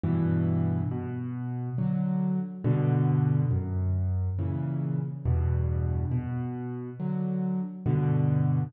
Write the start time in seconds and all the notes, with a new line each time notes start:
0.03 G2 B2 E3
0.91 B2
1.78 D3 F#3
2.64 G2 B2 D3
3.51 F#2
4.39 A#2 C#3 E3
5.25 E2 G2 B2
6.11 B2
7.00 D3 F#3
7.86 G2 B2 D3